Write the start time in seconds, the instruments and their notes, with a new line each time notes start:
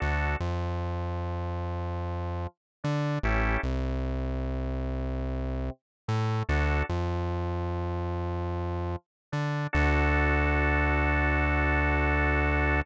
0.00 synth bass 1 D2, drawbar organ D4 F#4 A4
0.40 synth bass 1 F2, drawbar organ F3
2.84 synth bass 1 D3, drawbar organ D4
3.23 synth bass 1 A1, drawbar organ C#4 E4 G4 A4
3.63 synth bass 1 C2, drawbar organ C3
6.08 synth bass 1 A2, drawbar organ A3
6.49 synth bass 1 D2, drawbar organ D4 F#4 A4
6.89 synth bass 1 F2, drawbar organ F3
9.32 synth bass 1 D3, drawbar organ D4
9.73 synth bass 1 D2, drawbar organ D4 F#4 A4